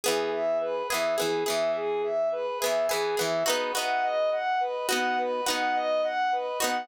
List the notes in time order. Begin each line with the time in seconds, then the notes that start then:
0.04 E3 B3 G#4
0.32 E5
0.61 B4
0.89 B3 G#4 E5
0.94 E3
1.17 B3 G#4
1.21 E3
1.45 B3 G#4 E5
1.50 E3
1.75 G#4
2.03 E5
2.32 B4
2.60 B3 G#4 E5
2.65 E3
2.89 E3 B3 G#4
3.17 E3 B3 G#4 E5
3.46 B3 D#4 F#4 B4
3.75 B3 D#4 F#4 F#5
4.03 D#5
4.31 F#5
4.60 B4
4.89 B3 D#4 F#4 F#5
5.18 B4
5.46 B3 D#4 F#4 F#5
5.75 D#5
6.03 F#5
6.32 B4
6.60 B3 D#4 F#4 F#5